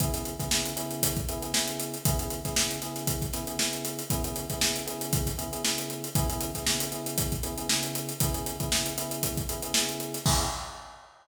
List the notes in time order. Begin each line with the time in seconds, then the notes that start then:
0.00 C#3 B3 E4 G#4, kick, closed hi-hat
0.13 C#3 B3 E4 G#4, snare, closed hi-hat
0.25 closed hi-hat
0.39 C#3 B3 E4 G#4, kick, snare, closed hi-hat
0.51 C#3 B3 E4 G#4, snare
0.65 snare, closed hi-hat
0.76 C#3 B3 E4 G#4, closed hi-hat
0.91 closed hi-hat
1.03 kick, closed hi-hat
1.17 kick, closed hi-hat
1.29 C#3 B3 E4 G#4, closed hi-hat
1.42 C#3 B3 E4 G#4, closed hi-hat
1.54 C#3 B3 E4 G#4, snare
1.68 closed hi-hat
1.80 closed hi-hat
1.94 closed hi-hat
2.05 C#3 B3 E4 G#4, kick, closed hi-hat
2.19 C#3 B3 E4 G#4, closed hi-hat
2.30 closed hi-hat
2.45 C#3 B3 E4 G#4, kick, snare, closed hi-hat
2.56 C#3 B3 E4 G#4, snare
2.71 closed hi-hat
2.82 C#3 B3 E4 G#4, snare, closed hi-hat
2.96 snare, closed hi-hat
3.07 kick, closed hi-hat
3.22 kick, closed hi-hat
3.33 C#3 B3 E4 G#4, snare, closed hi-hat
3.47 C#3 B3 E4 G#4, closed hi-hat
3.59 C#3 B3 E4 G#4, snare
3.73 closed hi-hat
3.85 closed hi-hat
3.99 closed hi-hat
4.10 C#3 B3 E4 G#4, kick, closed hi-hat
4.24 C#3 B3 E4 G#4, closed hi-hat
4.36 closed hi-hat
4.50 C#3 B3 E4 G#4, kick, snare, closed hi-hat
4.61 C#3 B3 E4 G#4, snare
4.76 closed hi-hat
4.87 C#3 B3 E4 G#4, closed hi-hat
5.01 closed hi-hat
5.13 kick, closed hi-hat
5.26 kick, snare, closed hi-hat
5.38 C#3 B3 E4 G#4, closed hi-hat
5.52 C#3 B3 E4 G#4, closed hi-hat
5.64 C#3 B3 E4 G#4, snare
5.78 snare, closed hi-hat
5.90 closed hi-hat
6.04 closed hi-hat
6.15 C#3 B3 E4 G#4, kick, closed hi-hat
6.30 C#3 B3 E4 G#4, closed hi-hat
6.41 closed hi-hat
6.55 C#3 B3 E4 G#4, kick, snare, closed hi-hat
6.66 C#3 B3 E4 G#4, snare
6.80 closed hi-hat
6.92 C#3 B3 E4 G#4, closed hi-hat
7.06 closed hi-hat
7.18 kick, closed hi-hat
7.32 kick, closed hi-hat
7.43 C#3 B3 E4 G#4, closed hi-hat
7.58 C#3 B3 E4 G#4, closed hi-hat
7.69 C#3 B3 E4 G#4, snare
7.83 closed hi-hat
7.95 closed hi-hat
8.09 closed hi-hat
8.20 C#3 B3 E4 G#4, kick, closed hi-hat
8.34 C#3 B3 E4 G#4, closed hi-hat
8.46 closed hi-hat
8.60 C#3 B3 E4 G#4, kick, closed hi-hat
8.72 C#3 B3 E4 G#4, snare
8.86 closed hi-hat
8.98 C#3 B3 E4 G#4, closed hi-hat
9.11 closed hi-hat
9.23 kick, closed hi-hat
9.37 kick, closed hi-hat
9.49 C#3 B3 E4 G#4, closed hi-hat
9.62 C#3 B3 E4 G#4, closed hi-hat
9.74 C#3 B3 E4 G#4, snare
9.89 closed hi-hat
10.00 closed hi-hat
10.14 snare, closed hi-hat
10.25 C#3 B3 E4 G#4, kick, crash